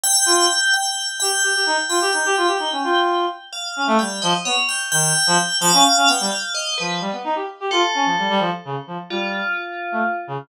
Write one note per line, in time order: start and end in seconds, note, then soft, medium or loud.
0.03 0.66 G5 loud
0.26 0.47 F4 medium
0.73 1.15 G5 medium
1.20 1.32 G4 medium
1.20 1.82 G5 loud
1.43 1.53 G4 medium
1.55 1.65 G4 medium
1.66 1.77 D#4 medium
1.89 1.99 F4 medium
1.89 2.10 G5 medium
2.01 2.12 G4 loud
2.13 2.23 D#4 medium
2.13 3.17 G5 medium
2.25 2.36 G4 loud
2.37 2.47 F4 medium
2.47 2.58 G4 medium
2.59 2.70 D#4 medium
2.72 2.82 C#4 medium
2.84 3.26 F4 medium
3.53 3.94 F5 medium
3.76 3.87 C#4 medium
3.87 3.98 A3 loud
3.99 4.20 G3 medium
3.99 4.20 G5 medium
4.22 4.33 F3 loud
4.22 4.32 D#5 medium
4.45 4.56 B3 medium
4.45 4.56 C#5 medium
4.69 4.79 G5 medium
4.92 5.12 D#3 medium
4.92 5.55 G5 loud
5.27 5.37 F3 loud
5.60 5.71 F3 loud
5.60 6.03 F5 loud
5.73 5.84 C#4 loud
5.96 6.07 C#4 medium
6.08 6.18 B3 medium
6.08 6.29 G5 medium
6.20 6.31 G3 medium
6.31 6.52 F5 medium
6.54 6.75 D#5 medium
6.78 7.00 F3 medium
6.78 6.99 B4 medium
7.01 7.11 G3 medium
7.12 7.23 B3 medium
7.24 7.35 D#4 medium
7.35 7.46 G4 medium
7.60 7.71 G4 medium
7.71 7.82 F4 loud
7.71 8.34 A4 medium
7.94 8.05 C#4 medium
8.05 8.16 F3 medium
8.18 8.29 G3 medium
8.30 8.40 G3 loud
8.39 8.50 F3 medium
8.65 8.75 C#3 medium
8.87 8.97 F3 medium
9.10 9.42 G3 medium
9.10 10.15 F4 medium
9.92 10.02 A3 medium
10.27 10.38 C#3 medium